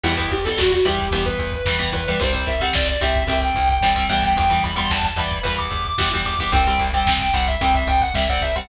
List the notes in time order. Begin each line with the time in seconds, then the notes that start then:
0.03 E2 E3 G3 B3 E4, crash
0.17 E3 G3 B3, kick
0.30 E2 G4, kick, ride
0.44 E3 G3 B3 A4, kick
0.58 E2 F#4, kick, snare
0.71 F#4, kick
0.85 E2 E3 G3 B3 G4, kick, ride
0.99 kick
1.11 E2 E3 G3 B3, kick, ride
1.26 B4, kick
1.39 E2, kick, ride
1.52 B4, kick
1.65 E2 E3 G3 B3, kick, snare
1.79 E3 G3 B3, kick
1.92 E2 B4, kick, ride
2.07 E3 G3 B3 B4, kick
2.20 C2 G3 C4 C5, kick, ride
2.33 G3 C4, kick
2.47 C2 E5, kick, ride
2.60 G3 C4 F#5, kick
2.73 C2 D5, kick, snare
2.88 D5, kick
3.01 C2 G3 C4 E5, kick, ride
3.15 kick
3.27 C2 G3 C4, kick, ride
3.41 G5, kick
3.55 C2, kick, ride
3.69 G5, kick
3.81 C2 G3 C4, kick, snare
3.96 G3 C4, kick
4.09 C2 E3 G3 B3 G5, kick, ride
4.23 G5, kick
4.36 E2 G5, kick, ride
4.50 E3 G3 B3, kick
4.63 E2 B5, kick, ride
4.76 E3 G3 B3 C6, kick
4.90 E2 A5, kick, snare
5.03 A5, kick
5.16 E2 E3 G3 B3 B5, kick, ride
5.31 kick
5.43 E2 E3 G3 B3, kick, ride
5.58 D6, kick
5.70 E2, kick, ride
5.85 D6, kick
5.98 E2 E3 G3 B3, kick, snare
6.13 E3 G3 B3, kick
6.25 E2 D6, kick, ride
6.39 E3 G3 B3 D6, kick
6.52 C2 G3 C4 G5, kick, ride
6.66 G3 C4, kick
6.78 C2, kick, ride
6.93 G3 C4 G5, kick
7.07 C2, kick, snare
7.19 G5, kick
7.33 C2 G3 C4 F#5, kick, ride
7.47 E5, kick
7.61 C2 G3 C4 G5, kick, ride
7.74 E5, kick
7.87 C2 G5, kick, ride
8.01 F#5, kick
8.14 C2 G3 C4 E5, kick, snare
8.29 G3 C4 F#5, kick
8.41 C2 E5, kick
8.56 G3 C4 F#5, kick